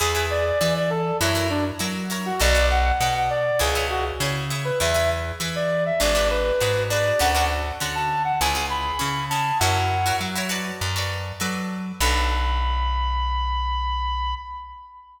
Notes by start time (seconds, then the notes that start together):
0.00 E2 E4 G#4 B4
0.15 E4 G#4 B4
0.30 D5
0.45 D5
0.59 E3 E4 G#4 B4 D5
0.76 D5
0.90 A4
1.20 F#2 E4 F#4 A#4 C#5
1.35 E4 F#4 A#4 C#5
1.50 D4
1.79 F#3 E4 F#4 A#4 C#5
2.10 E4 F#4 A#4 C#5
2.26 F#4
2.40 B1 F#4 A4 B4 D5
2.55 F#4 A4 B4 D5
2.71 F#5
2.85 F#5
3.00 B2 F#4 A4 B4 D5 F#5
3.14 F#5
3.30 D5
3.59 C#2 E4 G#4 C#5
3.75 E4 G#4 C#5
3.90 F#4
4.20 C#3 E4 G#4 C#5
4.50 E4 G#4 C#5
4.65 B4
4.80 E2 E4 G#4 B4 E5
4.94 E4 G#4 B4
5.40 E3 E4 G#4 B4
5.56 D5
5.86 E5
6.00 G#1 D4 F#4 G#4 B4 D5
6.15 D4 F#4 G#4 B4
6.30 B4
6.60 G#2 D4 F#4 G#4 B4
6.90 D4 F#4 G#4 B4 D5
7.19 D2 C#4 D4 F#4 A4 F#5
7.35 C#4 D4 F#4 A4
7.80 D3 C#4 D4 F#4 A4
7.95 A5
8.25 F#5
8.41 C#2 C#4 E4 G#4 G#5
8.55 C#4 E4 G#4
8.70 B5
8.99 C#3 C#4 E4 G#4
9.30 C#4 E4 G#4 A5
9.60 F#2 E4 F#4 A#4 C#5 F#5
10.06 E4 F#4 A#4 C#5
10.21 F#3
10.36 E4 F#4 A#4 C#5
10.49 F#4 A4 B4 D5
10.81 F#2
10.96 F#4 A4 B4 D5
11.40 F#3 F#4 A4 B4 D5
12.00 B1 D4 F#4 A4 B4 B5